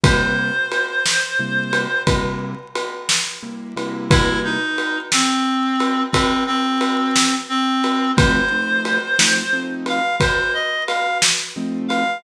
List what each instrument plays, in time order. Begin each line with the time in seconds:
0.04 acoustic grand piano C3 G3 A#3 E4, clarinet C5, kick, ride
0.72 ride
1.06 snare
1.39 acoustic grand piano C3 G3 A#3 E4
1.73 ride
2.07 acoustic grand piano C3 G3 A#3 E4, kick, ride
2.75 ride
3.09 snare
3.43 acoustic grand piano C3 G3 A#3 E4
3.76 acoustic grand piano C3 G3 A#3 E4, ride
4.10 clarinet E4, kick, ride
4.44 clarinet D#4
4.78 ride
5.12 clarinet C4, snare
5.80 ride
6.12 clarinet C4, kick, ride
6.47 clarinet C4
6.81 ride
7.16 snare
7.49 clarinet C4
7.84 ride
8.16 acoustic grand piano F3 A3 C4 D#4, clarinet C5, kick, ride
8.51 acoustic grand piano F3 A3 C4 D#4
8.85 ride
9.19 acoustic grand piano F3 A3 C4 D#4, snare
9.53 acoustic grand piano F3 A3 C4 D#4
9.86 clarinet F5, ride
10.20 clarinet C5, kick, ride
10.54 clarinet D#5
10.87 clarinet F5, ride
11.22 snare
11.56 acoustic grand piano F3 A3 C4 D#4
11.88 clarinet F5, ride